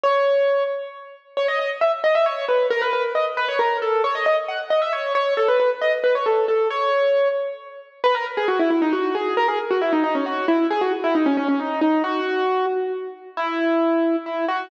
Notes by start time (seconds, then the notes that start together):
0.04 C#5
1.37 C#5
1.48 D#5
1.59 D#5
1.81 E5
2.04 D#5
2.15 E5
2.26 C#5
2.49 B4
2.70 A#4
2.82 B4
2.93 B4
3.15 D#5
3.37 B4
3.48 C#5
3.59 A#4
3.82 A4
4.04 C#5
4.15 D#5
4.26 D#5
4.48 F#5
4.70 D#5
4.82 E5
4.93 C#5
5.15 C#5
5.37 A4
5.48 B4
5.60 B4
5.81 D#5
6.04 B4
6.15 C#5
6.26 A4
6.48 A4
6.70 C#5
8.04 B4
8.15 A#4
8.37 G#4
8.48 F#4
8.59 E4
8.70 E4
8.82 D#4
8.93 F#4
9.15 G#4
9.37 A#4
9.48 G#4
9.71 F#4
9.82 E4
9.93 D#4
10.04 D#4
10.15 C#4
10.26 F#4
10.48 E4
10.70 G#4
10.81 F#4
11.04 E4
11.15 D#4
11.26 C#4
11.37 C#4
11.48 C#4
11.60 D#4
11.81 D#4
12.04 F#4
13.37 E4
14.26 E4
14.48 F#4